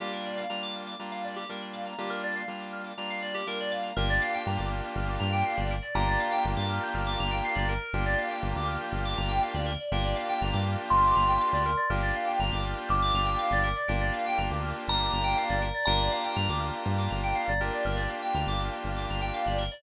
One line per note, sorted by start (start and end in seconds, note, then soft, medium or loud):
0.00 0.45 G3 medium
0.00 0.45 A#3 medium
0.00 0.45 D4 medium
0.00 0.45 F4 medium
0.00 0.11 G4 medium
0.13 0.24 A#4 medium
0.26 0.37 D5 medium
0.38 0.49 F5 medium
0.49 0.94 G3 medium
0.49 0.94 A#3 medium
0.49 0.94 D4 medium
0.49 0.94 F4 medium
0.49 0.61 A#5 medium
0.63 0.74 D6 medium
0.75 0.86 F6 medium
0.87 0.98 D6 medium
0.99 1.44 G3 medium
0.99 1.44 A#3 medium
0.99 1.44 D4 medium
0.99 1.44 F4 medium
0.99 1.11 A#5 medium
1.12 1.23 F5 medium
1.24 1.35 D5 medium
1.36 1.47 G4 medium
1.49 1.94 G3 medium
1.49 1.94 A#3 medium
1.49 1.94 D4 medium
1.49 1.94 F4 medium
1.49 1.61 A#4 medium
1.62 1.73 D5 medium
1.73 1.85 F5 medium
1.86 1.97 A#5 medium
1.98 2.43 G3 medium
1.98 2.43 A#3 medium
1.98 2.43 D4 medium
1.98 2.43 F4 medium
1.98 2.10 G4 medium
2.10 2.21 A#4 medium
2.24 2.35 D5 medium
2.36 2.47 F5 medium
2.48 2.92 G3 medium
2.48 2.92 A#3 medium
2.48 2.92 D4 medium
2.48 2.92 F4 medium
2.48 2.60 A#5 medium
2.60 2.71 D6 medium
2.73 2.84 F6 medium
2.84 2.96 D6 medium
2.98 3.42 G3 medium
2.98 3.42 A#3 medium
2.98 3.42 D4 medium
2.98 3.42 F4 medium
2.98 3.09 A#5 medium
3.10 3.21 F5 medium
3.22 3.33 D5 medium
3.34 3.45 G4 medium
3.47 3.91 G3 medium
3.47 3.91 A#3 medium
3.47 3.91 D4 medium
3.47 3.91 F4 medium
3.47 3.58 A#4 medium
3.60 3.72 D5 medium
3.72 3.83 F5 medium
3.83 3.94 A#5 medium
3.96 4.19 G1 medium
3.96 5.75 A#3 loud
3.96 5.75 D4 loud
3.96 5.75 F4 loud
3.96 5.75 G4 loud
3.96 4.08 A#4 loud
4.10 4.21 D5 medium
4.21 4.33 F5 medium
4.34 4.45 G5 medium
4.46 4.58 G2 medium
4.46 4.58 A#5 medium
4.58 4.81 G1 medium
4.58 4.69 D6 medium
4.71 4.82 F6 medium
4.84 4.95 G6 medium
4.96 5.18 G1 medium
4.96 5.07 F6 medium
5.09 5.20 D6 medium
5.20 5.43 G2 medium
5.20 5.31 A#5 medium
5.32 5.43 G5 medium
5.45 5.56 F5 medium
5.57 5.80 G1 medium
5.57 5.68 D5 medium
5.71 5.82 A#4 medium
5.82 5.93 D5 medium
5.95 6.17 G1 medium
5.95 7.73 A#3 loud
5.95 7.73 D4 medium
5.95 7.73 F4 loud
5.95 7.73 G4 loud
5.95 6.06 A#4 medium
5.95 7.76 A#5 medium
6.08 6.19 D5 medium
6.20 6.31 F5 medium
6.32 6.43 G5 medium
6.45 6.56 G1 medium
6.45 6.56 A#5 medium
6.57 6.79 G2 medium
6.57 6.68 D6 medium
6.69 6.81 F6 medium
6.83 6.94 G6 medium
6.94 7.17 G1 medium
6.94 7.06 F6 medium
7.07 7.18 D6 medium
7.19 7.41 G1 medium
7.19 7.31 A#5 medium
7.31 7.42 G5 medium
7.45 7.56 F5 medium
7.55 7.78 G1 medium
7.55 7.66 D5 medium
7.69 8.05 A#4 loud
7.93 8.16 G1 medium
7.93 9.72 A#3 loud
7.93 9.72 D4 medium
7.93 9.72 F4 loud
7.93 9.72 G4 loud
8.06 8.17 D5 medium
8.18 8.29 F5 medium
8.30 8.41 G5 medium
8.42 8.54 G1 medium
8.42 8.53 A#5 medium
8.55 8.78 D2 medium
8.55 8.66 D6 medium
8.67 8.79 F6 medium
8.81 8.92 G6 medium
8.92 9.15 G1 medium
8.92 9.04 F6 medium
9.05 9.16 D6 medium
9.17 9.40 G1 medium
9.17 9.29 A#5 medium
9.29 9.40 G5 medium
9.43 9.54 F5 medium
9.54 9.77 D2 medium
9.54 9.66 D5 medium
9.66 9.77 A#4 medium
9.80 9.91 D5 medium
9.92 10.14 G1 medium
9.92 11.70 A#3 loud
9.92 11.70 D4 loud
9.92 11.70 F4 loud
9.92 11.70 G4 loud
9.92 10.04 A#4 medium
10.04 10.15 D5 medium
10.16 10.27 F5 medium
10.29 10.40 G5 medium
10.41 10.52 G1 medium
10.41 10.53 A#5 medium
10.53 10.76 G2 medium
10.53 10.64 D6 medium
10.65 10.77 F6 medium
10.79 10.90 G6 medium
10.90 11.13 G1 medium
10.90 11.86 C6 medium
10.90 11.02 F6 medium
11.04 11.16 D6 medium
11.15 11.38 G1 medium
11.15 11.27 A#5 medium
11.28 11.39 G5 medium
11.41 11.52 F5 medium
11.53 11.75 D2 medium
11.53 11.64 D5 medium
11.65 11.77 A#4 medium
11.77 11.88 D5 medium
11.90 12.12 G1 medium
11.90 13.69 A#3 medium
11.90 13.69 D4 loud
11.90 13.69 F4 loud
11.90 13.69 G4 loud
11.90 12.01 A#4 medium
12.02 12.14 D5 medium
12.16 12.27 F5 medium
12.27 12.38 G5 medium
12.40 12.51 G1 medium
12.40 12.51 A#5 medium
12.52 12.74 G1 medium
12.52 12.63 D6 medium
12.64 12.75 F6 medium
12.77 12.88 G6 medium
12.89 13.12 G1 medium
12.89 13.82 D6 medium
12.89 13.00 F6 medium
13.02 13.13 D6 medium
13.14 13.36 G1 medium
13.14 13.26 A#5 medium
13.25 13.36 G5 medium
13.39 13.50 F5 medium
13.51 13.73 G1 medium
13.51 13.64 D5 medium
13.63 13.75 A#4 medium
13.76 13.87 D5 medium
13.88 14.11 G1 medium
13.88 15.67 A#3 loud
13.88 15.67 D4 loud
13.88 15.67 F4 loud
13.88 15.67 G4 medium
13.88 13.99 A#4 loud
14.01 14.12 D5 medium
14.13 14.24 F5 medium
14.26 14.37 G5 medium
14.38 14.49 G1 medium
14.38 14.49 A#5 medium
14.51 14.73 D2 medium
14.51 14.62 D6 medium
14.62 14.74 F6 medium
14.76 14.87 G6 medium
14.88 15.10 G1 medium
14.88 15.85 A#5 medium
14.88 14.99 F6 medium
15.00 15.11 D6 medium
15.12 15.35 G1 medium
15.12 15.23 A#5 medium
15.24 15.35 G5 medium
15.38 15.49 F5 medium
15.49 15.72 G1 medium
15.49 15.61 D5 medium
15.62 15.73 A#4 medium
15.74 15.85 D5 medium
15.85 16.09 G1 medium
15.85 17.52 A#3 medium
15.85 17.52 D4 loud
15.85 17.52 F4 loud
15.85 17.52 G4 medium
15.85 15.98 A#4 medium
15.85 17.71 A#5 medium
15.99 16.10 D5 medium
16.11 16.23 F5 medium
16.24 16.35 G5 medium
16.36 16.48 G2 medium
16.36 16.47 A#5 medium
16.49 16.71 D2 medium
16.49 16.60 D6 medium
16.60 16.71 F6 medium
16.74 16.85 G6 medium
16.85 17.08 G2 medium
16.85 16.96 F6 medium
16.98 17.09 D6 medium
17.10 17.33 G1 medium
17.10 17.21 A#5 medium
17.23 17.35 G5 medium
17.35 17.46 F5 medium
17.48 17.70 G1 medium
17.48 17.60 D5 medium
17.60 19.64 A#3 medium
17.60 19.64 D4 loud
17.60 19.64 F4 medium
17.60 19.64 G4 loud
17.60 17.72 A#4 medium
17.73 17.84 D5 medium
17.85 18.07 G1 medium
17.85 17.96 A#4 loud
17.96 18.08 D5 medium
18.10 18.21 F5 medium
18.22 18.33 G5 medium
18.35 18.46 D2 medium
18.35 18.46 A#5 medium
18.47 18.70 G1 medium
18.47 18.59 D6 medium
18.59 18.71 F6 medium
18.72 18.83 G6 medium
18.84 19.06 G1 medium
18.84 18.96 F6 medium
18.96 19.07 D6 medium
19.09 19.31 G1 medium
19.09 19.21 A#5 medium
19.21 19.32 G5 medium
19.34 19.45 F5 medium
19.46 19.69 G1 medium
19.46 19.58 D5 medium
19.58 19.70 A#4 medium
19.71 19.82 D5 medium